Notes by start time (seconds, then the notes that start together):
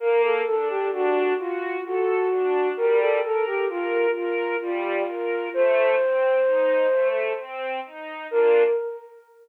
0.00 A#3 A#4
0.23 A4
0.46 D4 A4
0.69 G4
0.92 D4 F#4
1.38 F4 F#4
1.85 F#4 A4
2.31 D4
2.77 G3 A#4
3.00 A4
3.23 A4 A#4
3.46 G4
3.69 F4 A#4
4.16 F4 A#4
4.61 G3 F4
5.08 A#4
5.54 A3 C5
5.99 C4
6.45 D#4
6.91 A3
7.38 C4
7.85 D#4
8.31 A#3 D4 F4 A#4